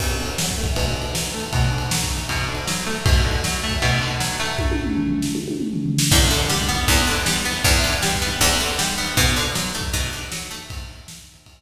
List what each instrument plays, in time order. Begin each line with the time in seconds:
0.00 acoustic guitar (steel) B2, kick, crash
0.19 acoustic guitar (steel) D3
0.26 ride
0.38 acoustic guitar (steel) F#3, snare
0.51 kick
0.58 acoustic guitar (steel) A3
0.64 kick, ride
0.76 acoustic guitar (steel) B2, kick, ride
0.96 acoustic guitar (steel) D3
1.02 ride
1.15 acoustic guitar (steel) F#3, snare
1.34 acoustic guitar (steel) A3
1.40 ride
1.53 acoustic guitar (steel) B2, kick, ride
1.72 acoustic guitar (steel) D3
1.78 ride
1.91 acoustic guitar (steel) F#3, snare
2.04 kick
2.10 acoustic guitar (steel) A3
2.17 ride
2.29 acoustic guitar (steel) B2, kick, ride
2.48 acoustic guitar (steel) D3
2.55 ride
2.67 acoustic guitar (steel) F#3, snare
2.86 acoustic guitar (steel) A3
2.93 ride
3.06 acoustic guitar (steel) B2, kick, ride
3.25 acoustic guitar (steel) D3
3.31 ride
3.44 acoustic guitar (steel) F#3, snare
3.63 acoustic guitar (steel) A3
3.69 kick, ride
3.82 acoustic guitar (steel) B2, kick, ride
4.01 acoustic guitar (steel) D3
4.08 ride
4.20 acoustic guitar (steel) F#3, snare
4.40 acoustic guitar (steel) A3
4.46 ride
4.59 kick, high tom
4.71 high tom
4.84 mid tom
4.97 floor tom
5.10 floor tom
5.22 snare
5.35 high tom
5.48 high tom
5.60 mid tom
5.73 floor tom
5.86 floor tom
5.98 snare
6.11 acoustic guitar (steel) E2, kick, crash
6.30 acoustic guitar (steel) D3
6.37 ride
6.49 acoustic guitar (steel) G3, snare
6.62 kick
6.69 acoustic guitar (steel) B3
6.75 kick, ride
6.88 acoustic guitar (steel) E2, kick, ride
7.07 acoustic guitar (steel) D3
7.13 ride
7.26 acoustic guitar (steel) G3, snare
7.45 acoustic guitar (steel) B3
7.52 ride
7.64 acoustic guitar (steel) E2, kick, ride
7.84 acoustic guitar (steel) D3
7.90 ride
8.02 acoustic guitar (steel) G3, snare
8.15 kick
8.22 acoustic guitar (steel) B3
8.28 ride
8.41 acoustic guitar (steel) E2, kick, ride
8.60 acoustic guitar (steel) D3
8.66 ride
8.79 acoustic guitar (steel) G3, snare
8.98 acoustic guitar (steel) B3
9.05 ride
9.17 acoustic guitar (steel) B2, kick, ride
9.36 acoustic guitar (steel) D3
9.43 ride
9.55 acoustic guitar (steel) F#3, snare
9.74 acoustic guitar (steel) A3
9.81 kick, ride
9.93 acoustic guitar (steel) B2, kick, ride
10.13 acoustic guitar (steel) D3
10.19 ride
10.32 acoustic guitar (steel) F#3, snare
10.51 acoustic guitar (steel) A3
10.57 ride
10.70 kick, ride
10.96 ride
11.08 snare
11.21 kick
11.34 ride
11.46 kick, ride